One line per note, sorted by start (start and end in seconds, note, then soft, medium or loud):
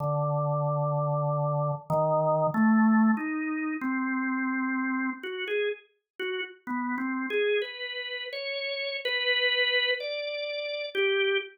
0.00 1.72 D3 medium
1.90 2.47 D#3 loud
2.54 3.11 A3 loud
3.17 3.74 D#4 medium
3.81 5.10 C4 medium
5.23 5.45 F#4 medium
5.48 5.69 G#4 medium
6.19 6.41 F#4 medium
6.67 6.95 B3 medium
6.98 7.26 C4 medium
7.30 7.59 G#4 medium
7.62 8.26 B4 medium
8.33 8.97 C#5 medium
9.05 9.91 B4 loud
10.00 10.86 D5 medium
10.95 11.38 G4 medium